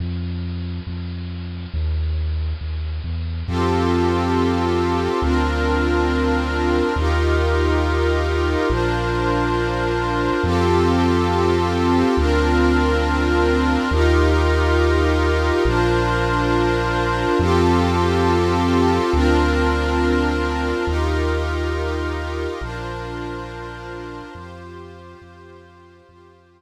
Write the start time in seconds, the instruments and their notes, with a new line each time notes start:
0.00 synth bass 2 F2
0.87 synth bass 2 F2
1.74 synth bass 2 D#2
2.61 synth bass 2 D#2
3.04 synth bass 2 E2
3.47 synth bass 2 F2, pad 5 (bowed) C4 F4 G4 A4
5.22 synth bass 2 D2, pad 5 (bowed) C4 D4 F4 A#4
6.96 synth bass 2 D#2, pad 5 (bowed) D#4 F4 G4 A#4
8.69 synth bass 2 A#1, pad 5 (bowed) D4 F4 A#4 C5
10.43 synth bass 2 F2, pad 5 (bowed) C4 F4 G4 A4
12.17 synth bass 2 D2, pad 5 (bowed) C4 D4 F4 A#4
13.91 synth bass 2 D#2, pad 5 (bowed) D#4 F4 G4 A#4
15.65 synth bass 2 A#1, pad 5 (bowed) D4 F4 A#4 C5
17.39 synth bass 2 F2, pad 5 (bowed) C4 F4 G4 A4
19.13 synth bass 2 D2, pad 5 (bowed) C4 D4 F4 A#4
20.87 synth bass 2 D#2, pad 5 (bowed) D#4 F4 G4 A#4
22.61 synth bass 2 A#1, pad 5 (bowed) D4 F4 A#4 C5
24.35 synth bass 2 F2, pad 5 (bowed) F4 G4 C5
25.21 synth bass 2 F2
26.08 synth bass 2 F2, pad 5 (bowed) F4 G4 C5